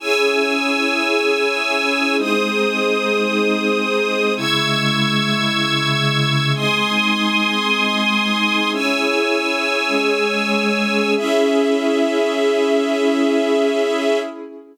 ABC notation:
X:1
M:4/4
L:1/8
Q:1/4=110
K:C#m
V:1 name="Pad 2 (warm)"
[CEG]8 | [G,^B,D]8 | [C,G,E]8 | [G,^B,D]8 |
"^rit." [CEG]4 [G,CG]4 | [CEG]8 |]
V:2 name="String Ensemble 1"
[cge']8 | [G^Bd']8 | [c'e'g']8 | [g^bd']8 |
"^rit." [cge']8 | [CGe]8 |]